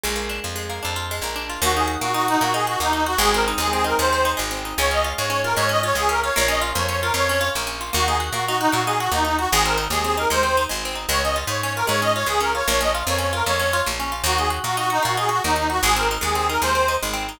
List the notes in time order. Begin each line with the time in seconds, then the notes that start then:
0.04 A#1 G#3
0.16 A#3
0.29 D4
0.44 F2 F4
0.56 G#3
0.70 A#3
0.83 F2 D4
0.96 F4
1.11 G#3
1.22 A#1 A#3
1.36 D4
1.50 F4
1.62 D#2 A#3 F#4
1.75 D#4 G#4
1.88 F#4
2.01 A#2 A#3 F#4
2.14 D#4 F#4
2.28 D#4 F#4
2.41 A#2 A#3 F#4
2.54 D#4 G#4
2.67 F#4
2.80 D#2 A#3 D#4
2.93 D#4
3.06 F#4
3.18 G#1 G#3 G#4
3.33 C4 A#4
3.48 D#4
3.58 D#2 G#3 G#4
3.73 C4 G#4
3.84 D#4 A#4
3.99 D#2 G#3 C5
4.13 C4
4.25 D#4
4.37 G#1 G#3
4.51 C4
4.65 D#4
4.78 C#2 G#3 C#5
4.91 C#4 D#5
5.04 F4
5.17 G#2 G#3 C#5
5.30 C#4 C#5
5.44 F4 A#4
5.56 G#2 G#3 C#5
5.69 C#4 D#5
5.83 F4 C#5
5.95 C#2 G#3 G#4
6.09 C#4 A#4
6.23 F4 C#5
6.36 A#1 A#3 C#5
6.48 C#4 D#5
6.61 F4
6.75 F2 A#3 C#5
6.89 C#4 C#5
7.02 F4 A#4
7.14 F2 A#3 C#5
7.29 C#4
7.41 F4
7.55 A#1 A#3
7.67 C#4
7.81 F4
7.93 D#2 A#3 F#4
8.07 D#4 G#4
8.20 F#4
8.32 A#2 A#3 F#4
8.47 D#4 F#4
8.60 D#4 F#4
8.72 A#2 A#3 F#4
8.86 D#4 G#4
8.99 F#4
9.12 D#2 A#3 D#4
9.25 D#4
9.39 F#4
9.52 G#1 G#3 G#4
9.65 C4 A#4
9.78 D#4
9.90 D#2 G#3 G#4
10.04 C4 G#4
10.17 D#4 A#4
10.30 D#2 G#3 C5
10.43 C4
10.57 D#4
10.69 G#1 G#3
10.85 C4
10.95 D#4
11.09 C#2 G#3 C#5
11.23 C#4 D#5
11.36 F4
11.47 G#2 G#3 C#5
11.62 C#4 C#5
11.76 F4 A#4
11.87 G#2 G#3 C#5
12.02 C#4 D#5
12.15 F4 C#5
12.26 C#2 G#3 G#4
12.40 C#4 A#4
12.55 F4 C#5
12.67 A#1 A#3 C#5
12.81 C#4 D#5
12.95 F4
13.07 F2 A#3 C#5
13.18 C#4 C#5
13.33 F4 A#4
13.46 F2 A#3 C#5
13.59 C#4
13.73 F4
13.86 A#1 A#3
14.00 C#4
14.12 F4
14.24 D#2 A#3 F#4
14.38 D#4 G#4
14.50 F#4
14.64 A#2 A#3 F#4
14.77 D#4 F#4
14.90 D#4 F#4
15.03 A#2 A#3 F#4
15.17 D#4 G#4
15.29 F#4
15.44 D#2 A#3 D#4
15.56 D#4
15.70 F#4
15.83 G#1 G#3 G#4
15.96 C4 A#4
16.11 D#4
16.21 D#2 G#3 G#4
16.35 C4 G#4
16.49 D#4 A#4
16.62 D#2 G#3 C5
16.75 C4
16.88 D#4
17.03 G#1 G#3
17.14 C4
17.29 D#4